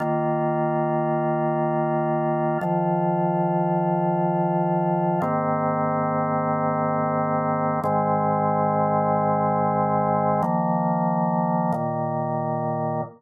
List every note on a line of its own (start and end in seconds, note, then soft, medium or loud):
0.00 2.58 D#3 loud
0.00 2.58 A#3 medium
0.00 2.58 F4 medium
2.61 5.20 D#3 medium
2.61 5.20 F3 medium
2.61 5.20 F4 medium
5.22 7.80 G#2 medium
5.22 7.80 D#3 medium
5.22 7.80 A#3 medium
5.22 7.80 C4 loud
7.84 10.42 G#2 medium
7.84 10.42 D#3 medium
7.84 10.42 G#3 medium
7.84 10.42 C4 medium
10.43 11.72 D#3 medium
10.43 11.72 F3 medium
10.43 11.72 A#3 medium
11.72 13.02 A#2 medium
11.72 13.02 D#3 medium
11.72 13.02 A#3 medium